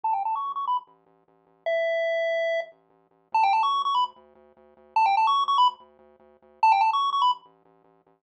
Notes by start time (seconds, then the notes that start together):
0.04 A1 A5
0.13 G5
0.24 A1 A5
0.35 C#6
0.45 A1
0.56 C#6
0.64 A1 B5
0.87 A1
1.06 A1
1.28 A1
1.47 A1
1.66 A1 E5
1.88 A1
2.11 A1
2.30 A1
2.51 A1
2.72 A1
2.90 A1
3.11 A1
3.32 D2 A5
3.43 G5
3.53 D2 A5
3.63 C#6
3.73 D2
3.85 C#6
3.95 D2 B5
4.16 D2
4.35 D2
4.57 D2
4.77 D2
4.96 D2 A5
5.06 G5
5.17 D2 A5
5.27 C#6
5.38 D2
5.48 C#6
5.58 D2 B5
5.80 D2
5.99 D2
6.20 D2
6.42 D2
6.63 A1 A5
6.72 G5
6.81 A1 A5
6.93 C#6
7.01 A1
7.13 C#6
7.22 A1 B5
7.45 A1
7.65 A1
7.84 A1
8.07 A1